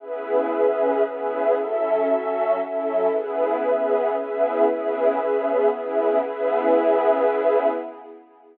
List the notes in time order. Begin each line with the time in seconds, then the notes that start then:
0.00 C#3 B3 C#4 E4 G#4 B4 E5
0.51 C#3 B3 C#4 G#4
1.03 C#3 B3 C#4 E4 G#4 B4 E5
1.55 F#3 C#4 E4 A4 E5
2.06 F#3 C#4 F#4 A4
2.59 F#3 C#4 E4 A4 E5
3.10 C#3 B3 C#4 E4 G#4 B4 E5
3.62 C#3 B3 C#4 G#4
4.14 C#3 B3 C#4 E4 G#4 B4 E5
4.65 C#3 B3 C#4 E4 G#4 B4 E5
5.16 C#3 B3 C#4 G#4
5.69 C#3 B3 C#4 E4 G#4 B4 E5
6.20 C#3 B3 C#4 E4 G#4 B4 E5